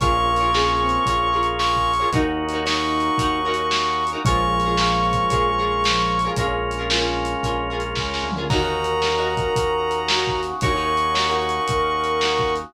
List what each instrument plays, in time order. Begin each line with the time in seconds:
0.00 synth bass 1 A#1, drawbar organ A#3 C#4 F4 G#4, lead 1 (square) C#4, overdriven guitar F4 G#4 A#4 C#5, brass section C#6, kick, closed hi-hat
0.27 lead 1 (square) A#3
0.36 overdriven guitar C#5, closed hi-hat
0.41 overdriven guitar F4 G#4 A#4
0.53 lead 1 (square) C#4, overdriven guitar F4 G#4 A#4 C#5, snare
0.80 lead 1 (square) C4
0.89 closed hi-hat
1.06 synth bass 1 A#1, overdriven guitar G#4 A#4 C#5, kick, closed hi-hat
1.10 overdriven guitar F4
1.33 overdriven guitar F4 G#4 A#4 C#5
1.43 closed hi-hat
1.59 brass section C#6, snare
1.76 kick
1.94 closed hi-hat
2.00 overdriven guitar F4 G#4 A#4 C#5
2.12 synth bass 1 D#2, drawbar organ A#3 C#4 D#4 F#4, lead 1 (square) D#4, overdriven guitar D#4 F#4 A#4 C#5, kick, closed hi-hat
2.49 closed hi-hat
2.53 overdriven guitar D#4 F#4 A#4 C#5
2.65 overdriven guitar D#4 F#4 A#4 C#5, brass section C#6, snare
3.00 closed hi-hat
3.18 synth bass 1 D#2, overdriven guitar D#4 F#4 A#4 C#5, kick, closed hi-hat
3.45 overdriven guitar D#4 F#4 A#4 C#5
3.54 closed hi-hat
3.71 snare
4.07 closed hi-hat
4.12 overdriven guitar D#4 F#4 A#4 C#5
4.25 synth bass 1 A#1, lead 1 (square) F3, drawbar organ G#3 A#3 C#4 F4, overdriven guitar F4 G#4 A#4 C#5, brass section C#6, kick, closed hi-hat
4.60 closed hi-hat
4.65 overdriven guitar F4 G#4 A#4 C#5
4.77 overdriven guitar G#4 A#4 C#5, snare
4.82 overdriven guitar F4
5.13 kick, closed hi-hat
5.30 synth bass 1 A#1, overdriven guitar F4 G#4 A#4 C#5, kick, closed hi-hat
5.58 overdriven guitar F4 G#4 A#4 C#5
5.84 lead 1 (square) F3, snare, closed hi-hat
6.19 closed hi-hat
6.24 overdriven guitar F4 G#4 A#4 C#5
6.36 synth bass 1 A#1, drawbar organ G#3 A#3 C#4 F4, lead 1 (square) C#4, overdriven guitar G#4 A#4 C#5, kick, closed hi-hat
6.41 overdriven guitar F4
6.71 closed hi-hat
6.78 overdriven guitar F4 G#4 A#4 C#5
6.90 overdriven guitar F4 G#4 A#4 C#5, snare
7.25 closed hi-hat
7.43 synth bass 1 A#1, overdriven guitar F4 G#4 A#4 C#5, kick, closed hi-hat
7.70 overdriven guitar F4 G#4 A#4 C#5
7.80 closed hi-hat
7.95 synth bass 1 C#2, lead 1 (square) C#4, kick, snare
8.14 snare
8.23 synth bass 1 D2
8.32 floor tom
8.36 overdriven guitar F4 G#4 A#4 C#5
8.50 synth bass 1 D#2, drawbar organ A#3 C#4 D#4 F#4, overdriven guitar D#4 F#4 A#4 C#5, lead 1 (square) A#4, brass section A#5, kick, crash
8.62 overdriven guitar D#4 F#4 A#4 C#5
8.84 closed hi-hat
9.02 overdriven guitar F#4 A#4 C#5, snare
9.07 overdriven guitar D#4
9.16 overdriven guitar D#4 F#4 A#4 C#5
9.37 kick, closed hi-hat
9.56 synth bass 1 D#2, kick, closed hi-hat
9.91 closed hi-hat
10.08 lead 1 (square) F#4, overdriven guitar F#4 A#4 C#5, snare
10.13 overdriven guitar D#4
10.27 kick
10.43 closed hi-hat
10.61 synth bass 1 D#2, drawbar organ A#3 C#4 D#4 F#4, overdriven guitar F#4 A#4 C#5, lead 1 (square) C#5, brass section C#6, kick, closed hi-hat
10.65 overdriven guitar D#4
10.75 overdriven guitar D#4 F#4 A#4 C#5
10.97 closed hi-hat
11.14 overdriven guitar D#4 F#4 A#4 C#5, snare
11.29 overdriven guitar D#4 F#4 A#4 C#5
11.49 closed hi-hat
11.68 synth bass 1 D#2, lead 1 (square) A#4, kick, closed hi-hat
12.04 closed hi-hat
12.21 overdriven guitar D#4 F#4 A#4 C#5, snare
12.39 kick
12.56 closed hi-hat